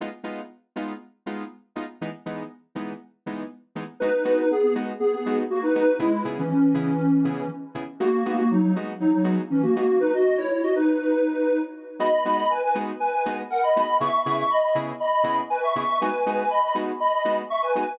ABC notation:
X:1
M:4/4
L:1/16
Q:1/4=120
K:G#m
V:1 name="Lead 1 (square)"
z16 | z16 | [DB]2 [DB] [DB] [B,G] [B,G] z2 [B,G] [B,G]2 z [A,F] [DB] [DB]2 | [G,E]2 z [E,C] [E,C]8 z4 |
[A,F]2 [A,F] [A,F] [F,D] [F,D] z2 [F,D] [F,D]2 z [E,C] [A,F] [A,F]2 | [DB] [Fd]2 [Ec] [Ec] [Fd] [DB]8 z2 | [db]2 [db] [db] [Bg] [Bg] z2 [Bg] [Bg]2 z [Af] [db] [db]2 | [ec']2 [ec'] [ec'] [db] [db] z2 [db] [db]2 z [Bg] [ec'] [ec']2 |
[Bg]2 [Bg] [Bg] [db] [db] z2 [db] [db]2 z [ec'] [Bg] [Bg]2 |]
V:2 name="Lead 2 (sawtooth)"
[G,B,D^E]2 [G,B,DE]4 [G,B,DE]4 [G,B,DE]4 [G,B,DE]2 | [E,G,B,D]2 [E,G,B,D]4 [E,G,B,D]4 [E,G,B,D]4 [E,G,B,D]2 | [G,B,DF]2 [G,B,DF]4 [G,B,DF]4 [G,B,DF]4 [G,B,DF]2 | [C,B,EG]2 [C,B,EG]4 [C,B,EG]4 [C,B,EG]4 [C,B,EG]2 |
[G,B,DF]2 [G,B,DF]4 [G,B,DF]4 [G,B,DF]4 [G,B,DF]2 | z16 | [G,B,DF]2 [G,B,DF]4 [G,B,DF]4 [G,B,DF]4 [G,B,DF]2 | [C,B,EG]2 [C,B,EG]4 [C,B,EG]4 [C,B,EG]4 [C,B,EG]2 |
[G,B,DF]2 [G,B,DF]4 [G,B,DF]4 [G,B,DF]4 [G,B,DF]2 |]